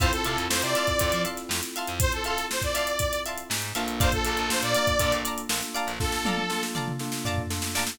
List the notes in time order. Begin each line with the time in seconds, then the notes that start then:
0.00 F2 C4 E4 F4 A4 C5 E5 F5 A5 C6, kick, closed hi-hat
0.12 A4, snare, closed hi-hat
0.24 C3 A4 E5 F5 A5 C6, closed hi-hat
0.37 F2, closed hi-hat
0.50 F2 C5, snare
0.62 C3 D5, snare, closed hi-hat
0.75 E5 F5 A5 C6, snare, closed hi-hat
0.87 kick, snare, closed hi-hat
0.99 F2, kick, closed hi-hat
1.12 F3, closed hi-hat
1.25 E5 F5 A5 C6, closed hi-hat
1.37 snare, closed hi-hat
1.49 F2, snare
1.63 closed hi-hat
1.76 E5 F5 A5 C6, closed hi-hat
1.88 F2, closed hi-hat
2.00 C5, kick, closed hi-hat
2.12 A4, closed hi-hat
2.24 A4 E5 F5 A5 C6, closed hi-hat
2.37 snare, closed hi-hat
2.50 C5, snare
2.62 D5, kick, closed hi-hat
2.74 E5 F5 A5 C6, snare, closed hi-hat
2.87 closed hi-hat
2.99 kick, closed hi-hat
3.12 snare, closed hi-hat
3.26 E5 F5 A5 C6, closed hi-hat
3.38 closed hi-hat
3.50 G#2, snare
3.62 snare, closed hi-hat
3.75 A#1 A#3 D4 F4 A4 E5 F5 A5 C6, closed hi-hat
3.88 closed hi-hat
4.00 C5 D5 F5 A5 A#5, kick, closed hi-hat
4.12 A4, kick, closed hi-hat
4.25 A#1 A4 D5 F5 A5 A#5, closed hi-hat
4.37 A#1, closed hi-hat
4.50 A#1 A#3 D4 F4 A4 C5, snare
4.62 A#2 D5, closed hi-hat
4.74 D5 F5 A5 A#5, snare, closed hi-hat
4.87 kick, closed hi-hat
4.99 A#2 A#3 D4 F4 A4, kick, closed hi-hat
5.12 A#1, closed hi-hat
5.25 D5 F5 A5 A#5, closed hi-hat
5.38 closed hi-hat
5.49 A#1 A#3 D4 F4 A4, snare
5.63 closed hi-hat
5.74 D5 F5 A5 A#5, closed hi-hat
5.87 A#1, snare, closed hi-hat
6.00 A#3 D4 F4 A4, kick, snare
6.12 snare
6.25 D5 F5 A5 A#5, high tom
6.38 high tom
6.50 A#3 D4 F4 A4, snare
6.63 snare
6.75 D5 F5 A5 A#5, mid tom
6.88 mid tom
6.99 A#3 D4 F4 A4, snare
7.12 snare
7.25 D5 F5 A5 A#5, floor tom
7.38 floor tom
7.50 A#3 D4 F4 A4, snare
7.62 snare
7.75 D5 F5 A5 A#5, snare
7.87 snare